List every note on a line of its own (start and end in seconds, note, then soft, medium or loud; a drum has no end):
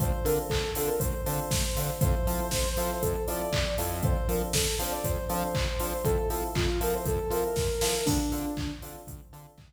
0.00 0.13 D2 medium
0.00 0.09 C4 loud
0.00 0.09 D4 loud
0.00 0.09 F4 loud
0.00 0.09 A4 loud
0.00 0.25 C5 medium
0.00 kick medium
0.00 closed hi-hat medium
0.24 0.39 D3 medium
0.24 0.43 C4 medium
0.24 0.43 D4 medium
0.24 0.43 F4 loud
0.24 0.43 A4 loud
0.24 0.36 A#4 medium
0.24 open hi-hat medium
0.48 0.64 D2 medium
0.48 0.70 A4 medium
0.48 kick medium
0.48 clap loud
0.75 0.90 D3 medium
0.75 0.93 C4 loud
0.75 0.93 D4 medium
0.75 0.93 F4 medium
0.75 0.93 A4 medium
0.75 0.89 A4 medium
0.75 open hi-hat medium
0.87 0.99 A#4 medium
0.99 1.15 D2 medium
0.99 1.21 C5 medium
0.99 kick medium
0.99 closed hi-hat loud
1.26 1.40 D3 medium
1.26 1.44 C4 medium
1.26 1.44 D4 medium
1.26 1.44 F4 medium
1.26 1.44 A4 medium
1.26 1.91 C5 medium
1.26 open hi-hat medium
1.51 1.66 D2 medium
1.51 kick medium
1.51 snare medium
1.76 1.91 D3 medium
1.76 1.85 C4 medium
1.76 1.85 D4 medium
1.76 1.85 F4 loud
1.76 1.85 A4 medium
1.76 open hi-hat medium
2.01 2.15 F2 loud
2.01 2.11 C4 loud
2.01 2.11 E4 loud
2.01 2.11 F4 loud
2.01 2.11 A4 loud
2.01 2.98 C5 loud
2.01 kick loud
2.01 closed hi-hat medium
2.27 2.41 F3 medium
2.27 2.45 C4 medium
2.27 2.45 E4 loud
2.27 2.45 F4 medium
2.27 2.45 A4 loud
2.27 open hi-hat medium
2.51 2.66 F2 medium
2.51 kick medium
2.51 snare medium
2.77 2.91 F3 medium
2.77 2.95 C4 medium
2.77 2.95 E4 medium
2.77 2.95 F4 loud
2.77 2.95 A4 medium
2.77 open hi-hat medium
3.02 3.16 F2 medium
3.02 3.23 A4 medium
3.02 kick medium
3.02 closed hi-hat medium
3.27 3.42 F3 medium
3.27 3.45 C4 medium
3.27 3.45 E4 loud
3.27 3.45 F4 medium
3.27 3.45 A4 medium
3.27 3.72 D5 medium
3.27 open hi-hat medium
3.52 3.66 F2 medium
3.52 kick medium
3.52 clap loud
3.78 4.18 F2 medium
3.78 3.87 C4 medium
3.78 3.87 E4 loud
3.78 3.87 F4 medium
3.78 3.87 A4 loud
3.78 open hi-hat medium
4.03 4.12 C4 loud
4.03 4.12 D4 loud
4.03 4.12 F4 loud
4.03 4.12 A4 loud
4.03 4.27 C5 medium
4.03 kick loud
4.03 closed hi-hat medium
4.28 4.42 F3 medium
4.28 4.46 C4 medium
4.28 4.46 D4 medium
4.28 4.46 F4 medium
4.28 4.46 A4 medium
4.28 4.40 A#4 medium
4.28 open hi-hat medium
4.53 4.68 F2 medium
4.53 4.75 A4 medium
4.53 kick medium
4.53 snare loud
4.79 4.93 F3 medium
4.79 4.97 C4 medium
4.79 4.97 D4 medium
4.79 4.97 F4 loud
4.79 4.97 A4 medium
4.79 4.93 C5 medium
4.79 open hi-hat medium
4.92 5.04 D5 medium
5.04 5.18 F2 medium
5.04 5.25 C5 medium
5.04 kick medium
5.04 closed hi-hat medium
5.29 5.44 F3 medium
5.29 5.47 C4 loud
5.29 5.47 D4 medium
5.29 5.47 F4 loud
5.29 5.47 A4 medium
5.29 6.04 C5 medium
5.29 open hi-hat medium
5.55 5.68 F2 medium
5.55 kick medium
5.55 clap medium
5.80 5.94 F3 medium
5.80 5.89 C4 medium
5.80 5.89 D4 loud
5.80 5.89 F4 medium
5.80 5.89 A4 medium
5.80 open hi-hat medium
6.04 6.18 F2 medium
6.04 6.14 C4 loud
6.04 6.14 E4 loud
6.04 6.14 F4 loud
6.04 6.28 A4 loud
6.04 6.14 A4 loud
6.04 kick medium
6.04 closed hi-hat medium
6.29 6.44 F3 medium
6.29 6.48 C4 medium
6.29 6.48 E4 loud
6.29 6.48 F4 medium
6.29 6.41 A4 medium
6.29 6.48 A4 loud
6.29 open hi-hat medium
6.55 6.70 F2 medium
6.55 6.79 F4 medium
6.55 kick medium
6.55 clap loud
6.81 6.95 F3 medium
6.81 6.98 C4 loud
6.81 6.98 E4 loud
6.81 6.98 F4 loud
6.81 6.98 A4 medium
6.81 6.94 A#4 medium
6.81 open hi-hat medium
6.94 7.06 C5 medium
7.05 7.20 F2 medium
7.05 7.32 A4 medium
7.05 kick medium
7.05 closed hi-hat medium
7.30 7.44 F3 medium
7.30 7.49 C4 medium
7.30 7.49 E4 medium
7.30 7.49 F4 medium
7.30 7.49 A4 medium
7.30 8.03 A#4 medium
7.30 open hi-hat medium
7.56 7.70 F2 medium
7.56 kick medium
7.56 snare medium
7.81 7.95 F3 medium
7.81 7.90 C4 medium
7.81 7.90 E4 medium
7.81 7.90 F4 medium
7.81 7.90 A4 medium
7.81 snare loud
8.05 8.21 D2 loud
8.05 8.16 C4 loud
8.05 8.70 D4 medium
8.05 8.16 D4 loud
8.05 8.16 F4 loud
8.05 8.16 A4 loud
8.05 kick medium
8.05 crash medium
8.32 8.46 D3 medium
8.32 8.50 C4 medium
8.32 8.50 D4 medium
8.32 8.50 F4 loud
8.32 8.50 A4 medium
8.32 open hi-hat medium
8.57 8.71 D2 medium
8.57 kick medium
8.57 clap medium
8.82 8.97 D3 medium
8.82 9.00 C4 medium
8.82 9.00 D4 loud
8.82 9.00 F4 loud
8.82 9.00 A4 medium
8.82 open hi-hat medium
9.07 9.21 D2 medium
9.07 kick medium
9.07 closed hi-hat medium
9.33 9.47 D3 medium
9.33 9.50 C4 medium
9.33 9.50 D4 loud
9.33 9.50 F4 medium
9.33 9.50 A4 loud
9.33 open hi-hat medium
9.58 9.72 D2 medium
9.58 kick medium
9.58 clap medium